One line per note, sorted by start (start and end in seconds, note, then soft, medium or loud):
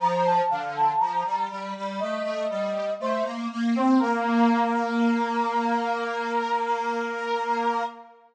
0.00 0.41 F3 loud
0.00 0.23 A#5 medium
0.26 0.50 A5 medium
0.50 0.92 D3 medium
0.50 0.74 F5 medium
0.76 1.00 A5 medium
1.00 1.24 F3 medium
1.00 1.40 A#5 medium
1.25 1.49 G3 medium
1.50 1.74 G3 medium
1.76 2.00 G3 loud
1.99 2.23 A3 loud
1.99 2.94 D#5 medium
2.23 2.47 A3 loud
2.50 2.90 G3 medium
3.00 3.24 A3 loud
3.00 3.25 C5 medium
3.24 3.48 A#3 medium
3.51 3.75 A#3 loud
3.75 3.99 C4 medium
3.75 4.00 C5 medium
3.99 7.83 A#3 loud
3.99 7.82 A#4 loud